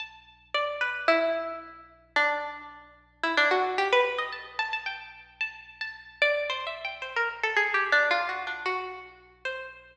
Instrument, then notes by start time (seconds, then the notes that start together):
pizzicato strings
0.00 A5
0.54 D5
0.81 B4
1.08 E4
2.16 D4
3.23 E4
3.37 D4
3.51 F#4
3.78 G4
3.93 B4
4.18 D#5
4.33 A5
4.59 A5
4.73 A5
4.86 G5
5.41 A5
5.81 A5
6.22 D5
6.50 C5
6.67 E5
6.85 G5
7.02 C5
7.16 A#4
7.43 A4
7.57 G#4
7.74 G4
7.92 D4
8.11 F4
8.29 F#4
8.47 D4
8.66 F#4
9.45 C5